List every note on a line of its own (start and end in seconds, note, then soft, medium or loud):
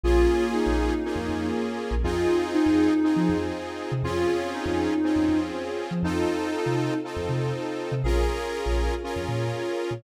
0.04 0.26 A#1 loud
0.04 0.94 A#3 medium
0.04 1.03 A#3 medium
0.04 0.94 C#4 medium
0.04 1.03 C#4 medium
0.04 0.50 F4 loud
0.04 0.94 F4 medium
0.04 1.03 F4 loud
0.04 0.94 G#4 loud
0.04 1.03 G#4 medium
0.54 1.46 D#4 medium
0.66 0.89 A#1 medium
1.05 2.04 A#3 medium
1.05 1.95 A#3 medium
1.05 2.04 C#4 medium
1.05 1.95 C#4 medium
1.05 1.95 F4 medium
1.05 2.03 G#4 medium
1.05 1.95 G#4 medium
1.05 2.04 A#4 medium
1.16 1.27 F2 loud
1.29 1.51 F2 medium
1.91 2.02 A#1 loud
2.03 2.27 F2 loud
2.03 3.02 C4 medium
2.03 2.94 C4 medium
2.03 3.02 D#4 medium
2.03 2.94 D#4 loud
2.03 3.02 F4 medium
2.03 2.44 F4 medium
2.03 2.94 F4 loud
2.03 3.02 G#4 medium
2.03 2.94 G#4 loud
2.54 3.38 D#4 medium
2.66 2.89 F2 medium
3.03 3.93 C4 medium
3.03 4.02 C4 medium
3.03 3.93 D#4 medium
3.03 4.03 D#4 medium
3.03 3.93 F4 medium
3.03 3.93 G#4 medium
3.03 4.02 G#4 medium
3.03 4.03 C5 medium
3.16 3.27 F3 medium
3.29 3.52 F2 loud
3.92 4.03 C3 loud
4.03 4.26 F2 loud
4.03 5.02 C4 medium
4.03 4.94 C4 medium
4.03 5.02 C#4 medium
4.03 4.94 C#4 loud
4.03 5.02 F4 medium
4.03 4.49 F4 medium
4.03 4.94 F4 loud
4.03 5.02 G#4 medium
4.03 4.94 G#4 medium
4.54 5.39 D#4 medium
4.66 4.88 F2 loud
5.03 6.02 C4 medium
5.03 5.94 C4 medium
5.03 6.02 C#4 medium
5.03 5.94 C#4 medium
5.03 5.94 F4 medium
5.03 6.02 G#4 medium
5.03 5.94 G#4 medium
5.03 6.02 C5 medium
5.16 5.27 F2 medium
5.29 5.51 F2 medium
5.91 6.02 F3 medium
6.03 6.25 F2 loud
6.03 7.02 C4 medium
6.03 6.94 C4 medium
6.03 7.02 D#4 loud
6.03 6.97 D#4 medium
6.03 6.94 D#4 loud
6.03 7.02 F4 medium
6.03 6.94 F4 loud
6.03 7.02 A4 medium
6.03 6.94 A4 loud
6.66 6.89 C3 medium
7.03 8.02 C4 medium
7.03 7.94 C4 medium
7.03 8.02 D#4 medium
7.03 7.94 D#4 medium
7.03 7.94 F4 medium
7.03 8.02 A4 loud
7.03 7.94 A4 medium
7.03 8.02 C5 medium
7.16 7.28 F2 loud
7.29 7.52 C3 medium
7.92 8.03 C3 medium
8.04 8.26 A#1 loud
8.04 9.03 C#4 medium
8.04 8.95 C#4 loud
8.04 9.03 F4 medium
8.04 8.95 F4 medium
8.04 8.47 G#4 medium
8.04 9.03 G#4 medium
8.04 8.95 G#4 medium
8.04 9.03 A#4 loud
8.04 8.95 A#4 loud
8.66 8.89 A#1 loud
9.03 10.02 C#4 medium
9.03 9.94 C#4 medium
9.03 10.02 F4 medium
9.03 9.94 F4 loud
9.03 9.94 G#4 medium
9.03 10.02 A#4 medium
9.03 9.94 A#4 medium
9.03 10.02 C#5 medium
9.16 9.27 F2 loud
9.28 9.51 A#2 loud
9.91 10.02 A#2 medium